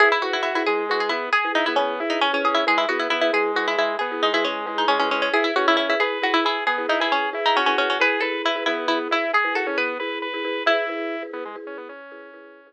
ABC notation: X:1
M:12/8
L:1/16
Q:3/8=90
K:E
V:1 name="Pizzicato Strings"
G E F E E E G2 F G E2 G2 D E C3 D C C G E | G E F E E E G2 F E E2 G2 D E C3 D C C C C | G E F E E E G2 F E E2 G2 D E C3 D C C C C | B2 A2 E2 E2 E z E2 G2 A2 B8 |
E12 z12 |]
V:2 name="Drawbar Organ"
E2 F2 F2 G,4 B,2 G2 E B, B,2 E2 C4 | G,2 B,2 B,2 G,4 G,2 B,2 G, G, G,2 G,2 G,4 | E2 C2 C2 B4 G2 B,2 E G G2 E2 F4 | G2 B2 B2 B,4 E2 G2 F C B,2 B2 B4 |
E6 B, G, z C B, C9 z4 |]
V:3 name="Marimba"
[EGB]2 [EGB]3 [EGB] [EGB]2 [EGB]5 [EGB]2 [EGB]3 [EGB]3 [EGB] [EGB]2 | [EGB]2 [EGB]3 [EGB] [EGB]2 [EGB]5 [EGB]2 [EGB]3 [EGB]3 [EGB] [EGB]2 | [EGB]2 [EGB]3 [EGB] [EGB]2 [EGB]5 [EGB]2 [EGB]3 [EGB]3 [EGB] [EGB]2 | [EGB]2 [EGB]3 [EGB] [EGB]2 [EGB]5 [EGB]2 [EGB]3 [EGB]3 [EGB] [EGB]2 |
[EGB]2 [EGB]3 [EGB] [EGB]2 [EGB]5 [EGB]2 [EGB]3 [EGB]3 z3 |]